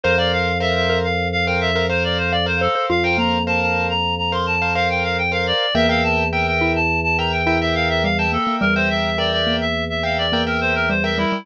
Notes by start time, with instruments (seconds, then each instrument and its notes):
0.04 drawbar organ F2, acoustic grand piano A#4 C5 F5, clarinet C5, xylophone C5
0.18 acoustic grand piano A#4 C5 F5, clarinet D5
0.33 clarinet F5
0.60 acoustic grand piano A#4 C5 F5, clarinet E5
0.75 clarinet E5
0.90 xylophone A#4
1.04 clarinet F5
1.32 clarinet F5
1.47 acoustic grand piano A#4 C5 F5, clarinet G5
1.61 clarinet E5
1.75 xylophone A#4, acoustic grand piano A#4 C5 F5
1.90 acoustic grand piano A#4 C5 F5, clarinet C5
2.04 clarinet D5
2.18 clarinet C5
2.32 clarinet D5, xylophone F5
2.46 acoustic grand piano A#4 C5 F5, clarinet C5
2.61 clarinet A4, xylophone C5
2.75 xylophone C5
2.90 drawbar organ F2, xylophone F4, clarinet F5
3.04 acoustic grand piano A#4 C5 F5, clarinet G5
3.18 xylophone A#3, clarinet A#5
3.47 acoustic grand piano A#4 C5 F5, clarinet A5
3.61 clarinet A5
3.90 clarinet A#5
4.18 clarinet A#5
4.32 acoustic grand piano A#4 C5 F5, clarinet C6
4.47 clarinet A5
4.62 acoustic grand piano A#4 C5 F5
4.75 acoustic grand piano A#4 C5 F5, clarinet F5
4.90 clarinet G5
5.04 clarinet F5
5.18 clarinet G5
5.32 acoustic grand piano A#4 C5 F5, clarinet F5
5.47 clarinet D5
5.75 drawbar organ E2, xylophone A#3, acoustic grand piano A#4 E5 G5, clarinet E5
5.89 acoustic grand piano A#4 E5 G5, clarinet F5
6.04 clarinet A5
6.32 acoustic grand piano A#4 E5 G5, clarinet G5
6.47 clarinet G5
6.61 xylophone E4
6.76 clarinet A5
7.04 clarinet A5
7.18 acoustic grand piano A#4 E5 G5, clarinet A#5
7.32 clarinet G5
7.47 xylophone E4, acoustic grand piano A#4 E5 G5
7.61 acoustic grand piano A#4 E5 G5, clarinet E5
7.75 clarinet F5
7.90 clarinet E5
8.04 xylophone G3, clarinet F5
8.18 acoustic grand piano A#4 E5 G5, clarinet A5
8.32 xylophone A#3, clarinet A4
8.47 xylophone A#3
8.61 drawbar organ E2, xylophone G3, clarinet A#4
8.75 acoustic grand piano A#4 E5 G5, clarinet C5
8.90 clarinet E5
9.18 acoustic grand piano A#4 E5 G5, clarinet D5
9.32 clarinet D5
9.47 xylophone A#3
9.61 clarinet E5
9.90 clarinet E5
10.03 acoustic grand piano A#4 E5 G5, clarinet F5
10.18 clarinet D5
10.32 xylophone A#3, acoustic grand piano A#4 E5 G5
10.47 clarinet A#4, acoustic grand piano A#4 E5 G5
10.61 clarinet C5
10.75 clarinet A#4
10.90 xylophone G3, clarinet C5
11.04 acoustic grand piano A#4 E5 G5, clarinet E5
11.18 xylophone G3, clarinet E4
11.32 xylophone G3